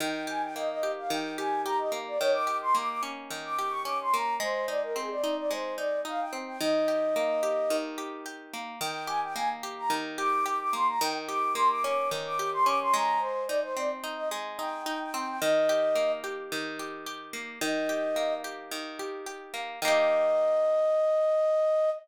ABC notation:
X:1
M:4/4
L:1/16
Q:1/4=109
K:Eb
V:1 name="Flute"
g2 a g e e2 f g2 a2 b e z d | _d =d'2 c' d' d' z3 d'2 _d' =d' c' b2 | c2 d B A d2 d c2 d2 f g z g | e10 z6 |
g2 a g a z2 b z2 d'2 d' d' c' b | g z d'2 c' d' d'2 z d'2 c' d' c' b2 | c2 d c d z2 e z2 g2 g g g g | e6 z10 |
e6 z10 | e16 |]
V:2 name="Acoustic Guitar (steel)"
E,2 G2 B,2 G2 E,2 G2 G2 B,2 | E,2 G2 B,2 _D2 E,2 G2 D2 B,2 | A,2 E2 C2 E2 A,2 E2 E2 C2 | E,2 G2 B,2 G2 E,2 G2 G2 B,2 |
E,2 G2 B,2 G2 E,2 G2 G2 B,2 | E,2 G2 B,2 _D2 E,2 G2 D2 A,2- | A,2 E2 C2 E2 A,2 E2 E2 C2 | E,2 G2 B,2 G2 E,2 G2 G2 B,2 |
E,2 G2 B,2 G2 E,2 G2 G2 B,2 | [E,B,G]16 |]